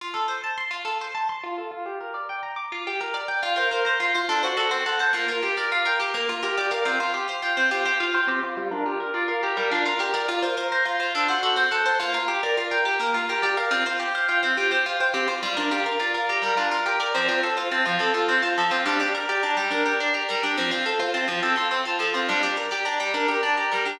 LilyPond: <<
  \new Staff \with { instrumentName = "Orchestral Harp" } { \time 6/8 \key f \major \tempo 4. = 70 r2. | r2. | f'16 c''16 bes'16 c''16 f'16 c''16 a'16 c''16 fis'16 c''16 a'16 c''16 | f'16 bes'16 g'16 bes'16 f'16 bes'16 g'16 bes'16 f'16 bes'16 g'16 bes'16 |
f'16 c''16 g'16 c''16 f'16 c''16 g'16 c''16 f'16 c''16 g'16 c''16 | f'16 bes'16 g'16 bes'16 f'16 bes'16 g'16 bes'16 f'16 bes'16 g'16 bes'16 | f'16 c''16 bes'16 c''16 f'16 c''16 a'16 c''16 fis'16 c''16 a'16 c''16 | f'16 bes'16 g'16 bes'16 f'16 bes'16 g'16 bes'16 f'16 bes'16 g'16 bes'16 |
f'16 c''16 g'16 c''16 f'16 c''16 g'16 c''16 f'16 c''16 g'16 c''16 | f'16 bes'16 g'16 bes'16 f'16 bes'16 g'16 bes'16 f'16 bes'16 g'16 bes'16 | c'16 f'16 a'16 f'16 c'16 f'16 a'16 f'16 c'16 f'16 a'16 f'16 | d'16 g'16 bes'16 g'16 d'16 g'16 bes'16 g'16 d'16 g'16 bes'16 g'16 |
c'16 f'16 a'16 f'16 c'16 f'16 a'16 f'16 c'16 f'16 a'16 f'16 | d'16 g'16 bes'16 g'16 d'16 g'16 bes'16 g'16 d'16 g'16 bes'16 g'16 | }
  \new Staff \with { instrumentName = "Orchestral Harp" } { \time 6/8 \key f \major f'16 a'16 c''16 a''16 c'''16 f'16 a'16 c''16 a''16 c'''16 f'16 a'16 | f'16 g'16 bes'16 d''16 g''16 bes''16 d'''16 f'16 g'16 bes'16 d''16 g''16 | r16 bes'16 c''16 bes''16 c'''16 f'16 d'16 fis'16 a'16 c'16 fis''16 a''16 | bes16 f'16 r16 d''16 f''16 g''16 d'''16 bes16 r16 g'16 d''16 f''16 |
c'16 f'16 r16 f''16 g''16 c'16 f'16 g'16 f''16 g''16 c'16 f'16 | g16 d'16 f'16 r16 d''16 f''16 bes''16 g16 d'16 f'16 bes'16 d''16 | r16 bes'16 c''16 bes''16 c'''16 f'16 d'16 fis'16 a'16 c'16 fis''16 a''16 | bes16 f'16 r16 d''16 f''16 g''16 d'''16 bes16 r16 g'16 d''16 f''16 |
c'16 f'16 r16 f''16 g''16 c'16 f'16 g'16 f''16 g''16 c'16 f'16 | g16 d'16 f'16 r16 d''16 f''16 bes''16 g16 d'16 f'16 bes'16 d''16 | f16 c'16 r16 c''16 a''16 f16 c'16 a'16 c''16 a''16 f16 c'16 | g16 d'16 r16 d''16 bes''16 g16 d'16 bes'16 d''16 bes''16 g16 d'16 |
f16 c'16 r16 c''16 a''16 f16 c'16 a'16 c''16 a''16 f16 c'16 | g16 d'16 r16 d''16 bes''16 g16 d'16 bes'16 d''16 bes''16 g16 d'16 | }
>>